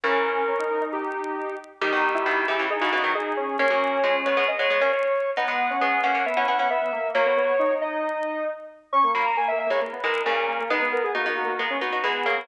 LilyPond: <<
  \new Staff \with { instrumentName = "Lead 1 (square)" } { \time 4/4 \key gis \minor \tempo 4 = 135 ais'2 g'4. r8 | g'4. g'8 gis'16 fis'16 fis'16 fis'16 gis'4 | cis''4. cis''8 dis''16 cis''16 cis''16 cis''16 cis''4 | fis''4. fis''8 e''16 fis''16 fis''16 fis''16 e''4 |
cis''4. dis''4. r4 | cis'''8 b''16 ais''16 gis''16 e''16 e''16 cis''16 r8 ais'8 ais'4 | b'8 ais'16 gis'16 fis'16 fis'16 fis'16 fis'16 r8 fis'8 gis'4 | }
  \new Staff \with { instrumentName = "Lead 1 (square)" } { \time 4/4 \key gis \minor cis'4 cis'16 dis'8 dis'4.~ dis'16 r8 | dis'8. e'8. e'8 dis'8 dis'8 dis'8 cis'8 | cis'2~ cis'8 r4. | b8. cis'8. cis'8 b8 b8 b8 ais8 |
ais16 b16 b8 dis'16 dis'2~ dis'16 r8 | cis'16 ais8. \tuplet 3/2 { ais8 ais8 ais8 } ais16 b16 r8 ais8 ais16 ais16 | dis'16 b8. \tuplet 3/2 { ais8 ais8 ais8 } ais16 cis'16 r8 b8 ais16 b16 | }
  \new Staff \with { instrumentName = "Pizzicato Strings" } { \time 4/4 \key gis \minor <cis e>2. r4 | <dis g>16 <b, dis>8. <b, dis>8 <cis e>16 <cis e>16 r16 <cis e>16 <cis e>16 <dis fis>16 r4 | <ais cis'>16 <fis ais>8. <eis gis>8 <gis b>16 <gis b>16 r16 <gis b>16 <gis b>16 <ais cis'>16 r4 | <b dis'>16 <gis b>8. <gis b>8 <ais cis'>16 <ais cis'>16 r16 <cis' e'>16 <cis' e'>16 <cis' e'>16 r4 |
<fis ais>4 r2. | r8 <fis ais>16 r4 <e gis>16 r8 <e gis>8 <ais, cis>4 | <gis b>4 <b dis'>16 <b dis'>8. <gis b>8 <b dis'>16 <dis' fis'>16 <e gis>8 <fis ais>8 | }
>>